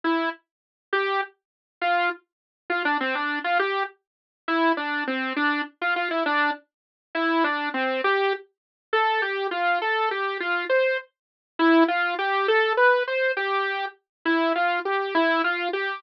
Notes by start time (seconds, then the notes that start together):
0.04 E4
0.93 G4
1.81 F4
2.70 F4
2.85 D4
3.00 C4
3.15 D4
3.44 F4
3.59 G4
4.48 E4
4.77 D4
5.07 C4
5.36 D4
5.81 F4
5.96 F4
6.11 E4
6.26 D4
7.15 E4
7.44 D4
7.74 C4
8.04 G4
8.93 A4
9.22 G4
9.51 F4
9.82 A4
10.11 G4
10.40 F4
10.69 C5
11.59 E4
11.88 F4
12.19 G4
12.48 A4
12.77 B4
13.07 C5
13.37 G4
14.25 E4
14.55 F4
14.85 G4
15.15 E4
15.44 F4
15.73 G4